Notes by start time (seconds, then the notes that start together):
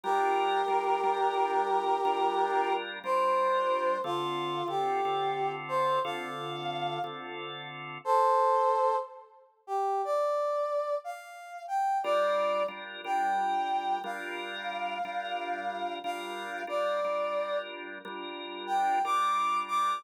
0.04 G3 D4 F4 G4 A#4
0.68 G3 D4 F4 A#4
1.04 G3 D4 F4 A#4
2.05 G3 D4 F4 A#4
3.04 G3 D4 F4 A#4 C5
4.04 D3 C4 F4 A4
4.68 D3 C4 F4 G4 A4
5.05 D3 C4 F4 A4
5.69 C5
6.04 D3 C4 F4 A4 F5
7.04 D3 C4 F4 A4
8.05 A4 C5
9.67 G4
10.05 D5
11.04 F5
11.68 G5
12.04 G3 D4 F4 A#4 D5
12.68 G3 D4 F4 A#4
13.04 G3 D4 F4 A#4 G5
14.04 G3 D4 F4 A#4 F5
15.05 G3 D4 F4 A#4
16.04 G3 D4 F4 A#4 F5
16.67 G3 D4 F4 A#4 D5
17.04 G3 D4 F4 A#4
18.05 G3 D4 F4 A#4
18.67 G5
19.05 G3 D4 F4 A#4 D6
19.68 D6